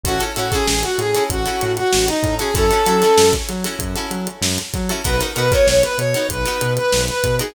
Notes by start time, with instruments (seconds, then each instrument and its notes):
0.04 synth bass 1 A1, pizzicato strings E4 F#4 A4, brass section F#4, kick, closed hi-hat
0.08 pizzicato strings C#4
0.20 pizzicato strings C#4 E4 F#4 A4, closed hi-hat
0.36 synth bass 1 A2, pizzicato strings C#4 E4 F#4 A4, brass section F#4, closed hi-hat
0.52 pizzicato strings C#4 E4 F#4 A4, brass section G#4, kick, closed hi-hat
0.68 synth bass 1 A1, brass section G#4, snare
0.83 brass section F#4, closed hi-hat
0.98 synth bass 1 A2, brass section G#4, closed hi-hat
1.15 pizzicato strings C#4 E4 F#4 A4, closed hi-hat
1.30 synth bass 1 A1, brass section F#4, kick, closed hi-hat
1.46 pizzicato strings C#4 E4 F#4 A4, closed hi-hat
1.61 synth bass 1 A2, snare, closed hi-hat
1.77 brass section F#4, snare, closed hi-hat
1.93 synth bass 1 A1, snare
2.08 brass section D#4, closed hi-hat
2.23 synth bass 1 A2, kick, closed hi-hat
2.39 pizzicato strings C#4 E4 F#4 A4, brass section G#4, closed hi-hat
2.54 synth bass 1 F#2, pizzicato strings C#4 E4 F#4 A4, brass section A4, kick, closed hi-hat
2.71 pizzicato strings C#4 E4 F#4 A4, closed hi-hat
2.86 synth bass 1 F#3, pizzicato strings C#4 E4 F#4 A4, closed hi-hat
3.02 pizzicato strings C#4 E4 F#4 A4, snare, closed hi-hat
3.18 synth bass 1 F#2, snare
3.33 kick, closed hi-hat
3.49 synth bass 1 F#3, closed hi-hat
3.64 pizzicato strings C#4 E4 F#4 A4, closed hi-hat
3.79 synth bass 1 F#2, kick, closed hi-hat
3.96 pizzicato strings C#4 E4 F#4 A4, closed hi-hat
4.11 synth bass 1 F#3, closed hi-hat
4.27 closed hi-hat
4.42 synth bass 1 F#2, snare
4.58 closed hi-hat
4.74 synth bass 1 F#3, kick, snare, closed hi-hat
4.89 pizzicato strings C#4 E4 F#4 A4, closed hi-hat
5.04 synth bass 1 B1, pizzicato strings B3 D#4 F#4 A#4, brass section B4, kick, closed hi-hat
5.20 pizzicato strings B3 D#4 F#4 A#4, closed hi-hat
5.36 synth bass 1 B2, pizzicato strings B3 D#4 F#4 A#4, brass section B4, closed hi-hat
5.52 pizzicato strings B3 D#4 F#4 A#4, brass section C#5, kick, closed hi-hat
5.67 synth bass 1 B1, brass section C#5, snare
5.83 brass section B4, closed hi-hat
5.98 synth bass 1 B2, brass section C#5, closed hi-hat
6.14 pizzicato strings B3 D#4 F#4 A#4, closed hi-hat
6.29 synth bass 1 B1, brass section B4, kick, closed hi-hat
6.45 pizzicato strings B3 D#4 F#4 A#4, closed hi-hat
6.61 synth bass 1 B2, closed hi-hat
6.77 brass section B4, closed hi-hat
6.92 synth bass 1 B1, snare
7.08 brass section B4, closed hi-hat
7.24 synth bass 1 B2, kick, closed hi-hat
7.39 pizzicato strings B3 D#4 F#4 A#4, brass section G#4, closed hi-hat